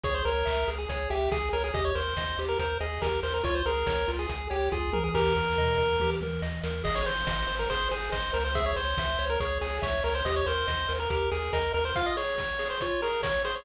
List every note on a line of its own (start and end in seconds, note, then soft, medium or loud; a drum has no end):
0.03 0.22 C#2 medium
0.03 0.23 G#4 loud
0.03 0.14 C#5 loud
0.03 kick medium
0.03 closed hi-hat medium
0.14 0.25 C5 medium
0.25 0.43 C#2 medium
0.25 0.70 A#4 loud
0.25 0.46 C#5 medium
0.25 open hi-hat medium
0.45 0.65 C#2 medium
0.45 0.65 E5 medium
0.45 kick medium
0.45 clap loud
0.67 0.86 C#2 medium
0.67 0.87 G#4 medium
0.67 open hi-hat medium
0.78 0.88 G#4 medium
0.89 1.07 C#2 medium
0.89 1.09 G#4 medium
0.89 1.09 C#5 loud
0.89 kick medium
0.89 closed hi-hat medium
1.10 1.28 C#2 medium
1.10 1.30 G4 medium
1.10 1.29 E5 medium
1.10 open hi-hat medium
1.31 1.50 C#2 medium
1.31 1.50 G#4 medium
1.31 1.49 G#4 loud
1.31 kick medium
1.31 snare medium
1.53 1.71 C#2 medium
1.53 1.63 A#4 medium
1.53 1.72 C#5 medium
1.53 open hi-hat medium
1.64 1.74 G#4 medium
1.74 1.92 D#2 medium
1.74 1.93 G4 loud
1.74 1.84 D#5 medium
1.74 kick medium
1.74 closed hi-hat medium
1.85 1.95 C#5 medium
1.95 2.14 D#2 medium
1.95 2.14 A#4 medium
1.95 2.40 C5 medium
1.95 open hi-hat medium
2.16 2.35 D#2 medium
2.16 2.36 D#5 medium
2.16 kick medium
2.16 snare loud
2.38 2.56 D#2 medium
2.38 2.58 G4 loud
2.38 open hi-hat medium
2.48 2.59 A#4 medium
2.59 2.77 D#2 medium
2.59 2.78 A#4 medium
2.59 2.79 C5 loud
2.59 kick medium
2.59 closed hi-hat medium
2.80 2.99 D#2 medium
2.80 3.01 G#4 medium
2.80 2.99 D#5 medium
2.80 open hi-hat medium
3.02 3.20 D#2 medium
3.02 3.21 G4 medium
3.02 3.20 A#4 medium
3.02 kick medium
3.02 snare medium
3.23 3.41 D#2 medium
3.23 3.42 A#4 medium
3.23 3.33 C5 medium
3.23 open hi-hat medium
3.34 3.44 A#4 medium
3.43 3.63 C#2 medium
3.43 3.63 F4 loud
3.43 3.55 C#5 loud
3.43 kick medium
3.43 closed hi-hat medium
3.55 3.65 C5 medium
3.65 3.84 C#2 medium
3.65 3.86 G#4 medium
3.65 4.11 A#4 medium
3.65 open hi-hat medium
3.87 4.05 C#2 medium
3.87 4.06 C#5 medium
3.87 kick medium
3.87 snare loud
4.08 4.26 C#2 medium
4.08 4.27 F4 medium
4.08 open hi-hat medium
4.19 4.29 G#4 medium
4.28 4.48 C#2 medium
4.28 4.47 G#4 medium
4.28 4.48 G#4 medium
4.28 kick medium
4.28 closed hi-hat medium
4.50 4.69 C#2 medium
4.50 4.70 G4 medium
4.50 4.69 C#5 medium
4.50 open hi-hat medium
4.71 4.90 C#2 medium
4.71 4.90 F4 medium
4.71 4.93 G#4 medium
4.71 kick medium
4.71 floor tom medium
4.93 5.11 C#2 medium
4.93 5.12 G#4 medium
4.93 5.03 A#4 medium
4.93 high tom medium
5.04 5.14 G#4 medium
5.14 5.33 D#2 medium
5.14 5.33 G4 loud
5.14 6.10 A#4 loud
5.14 kick medium
5.14 floor tom medium
5.14 crash medium
5.36 5.54 D#2 medium
5.36 5.56 A#4 medium
5.36 floor tom medium
5.57 5.75 D#2 medium
5.57 5.77 D#5 medium
5.57 mid tom medium
5.78 5.97 D#2 medium
5.78 5.97 A#4 medium
5.78 mid tom medium
6.00 6.18 D#2 medium
6.00 6.20 G4 medium
6.00 high tom medium
6.21 6.39 D#2 medium
6.21 6.42 A#4 medium
6.21 high tom medium
6.42 6.60 D#2 medium
6.42 6.61 D#5 medium
6.42 snare medium
6.63 6.82 D#2 medium
6.63 6.83 A#4 medium
6.63 snare medium
6.84 7.03 G#1 medium
6.84 7.03 G#4 loud
6.84 6.95 D#5 loud
6.84 kick medium
6.84 crash loud
6.95 7.06 C#5 medium
7.06 7.24 G#1 medium
7.06 7.25 C5 medium
7.06 7.55 C5 medium
7.06 open hi-hat medium
7.26 7.45 G#1 medium
7.26 7.46 D#5 medium
7.26 kick medium
7.26 snare loud
7.47 7.67 G#1 medium
7.47 7.66 C5 medium
7.47 open hi-hat medium
7.59 7.69 A#4 medium
7.70 7.88 G#1 medium
7.70 7.89 G#4 loud
7.70 7.88 C5 loud
7.70 kick medium
7.70 closed hi-hat medium
7.91 8.09 G#1 medium
7.91 8.10 G#4 medium
7.91 8.10 C5 loud
7.91 open hi-hat medium
8.12 8.31 G#1 medium
8.12 8.33 C5 medium
8.12 8.31 D#5 medium
8.12 kick medium
8.12 clap medium
8.33 8.73 C#2 loud
8.33 8.44 A#4 medium
8.33 8.52 C5 medium
8.33 open hi-hat medium
8.45 8.55 C5 medium
8.55 8.74 G#4 loud
8.55 8.65 E5 loud
8.55 kick medium
8.55 closed hi-hat medium
8.66 8.76 C#5 medium
8.76 8.94 C#2 medium
8.76 9.25 C5 medium
8.76 8.96 C#5 medium
8.76 open hi-hat medium
8.97 9.16 C#2 medium
8.97 9.18 E5 medium
8.97 kick medium
8.97 snare loud
9.19 9.37 C#2 medium
9.19 9.38 C#5 loud
9.19 open hi-hat medium
9.30 9.40 A#4 medium
9.40 9.58 C#2 medium
9.40 9.59 G#4 medium
9.40 9.58 C#5 medium
9.40 kick medium
9.40 closed hi-hat medium
9.61 9.80 C#2 medium
9.61 9.78 G#4 medium
9.61 9.80 C#5 medium
9.61 open hi-hat medium
9.82 10.01 C#2 medium
9.82 10.03 C#5 medium
9.82 10.01 E5 medium
9.82 kick medium
9.82 snare medium
10.04 10.22 C#2 medium
10.04 10.14 A#4 medium
10.04 10.24 C#5 medium
10.04 open hi-hat medium
10.15 10.25 C5 medium
10.25 10.43 D#2 loud
10.25 10.45 G4 loud
10.25 10.35 D#5 medium
10.25 kick medium
10.25 closed hi-hat loud
10.36 10.46 C#5 loud
10.46 10.65 D#2 medium
10.46 10.67 A#4 loud
10.46 10.93 C5 loud
10.46 open hi-hat medium
10.67 10.86 D#2 medium
10.67 10.87 D#5 medium
10.67 kick medium
10.67 snare medium
10.88 11.07 D#2 medium
10.88 11.08 A#4 medium
10.88 open hi-hat medium
11.00 11.10 A#4 medium
11.10 11.28 D#2 medium
11.10 11.29 G4 loud
11.10 11.30 A#4 medium
11.10 kick medium
11.10 closed hi-hat medium
11.31 11.50 D#2 medium
11.31 11.52 G#4 medium
11.31 11.51 A#4 medium
11.31 open hi-hat medium
11.53 11.71 D#2 medium
11.53 11.73 A#4 medium
11.53 11.72 D#5 loud
11.53 kick medium
11.53 snare medium
11.74 11.92 D#2 medium
11.74 11.93 A#4 medium
11.74 11.84 A#4 medium
11.74 open hi-hat medium
11.85 11.95 C5 medium
11.95 12.16 F4 loud
11.95 12.06 F5 loud
11.95 kick medium
11.95 closed hi-hat medium
12.06 12.16 D#5 medium
12.17 12.36 G#4 medium
12.17 12.68 C#5 medium
12.17 open hi-hat medium
12.38 12.58 C#5 medium
12.38 kick medium
12.38 snare medium
12.38 open hi-hat soft
12.59 12.78 G#4 medium
12.59 open hi-hat medium
12.70 12.80 C5 medium
12.80 13.01 F4 loud
12.80 13.01 C#5 medium
12.80 kick medium
12.80 closed hi-hat medium
13.02 13.22 G#4 medium
13.02 13.22 A#4 medium
13.02 open hi-hat medium
13.23 13.43 C#5 medium
13.23 13.42 C#5 loud
13.23 kick medium
13.23 snare loud
13.45 13.64 G#4 loud
13.45 13.55 C5 medium
13.45 open hi-hat medium
13.55 13.65 C#5 medium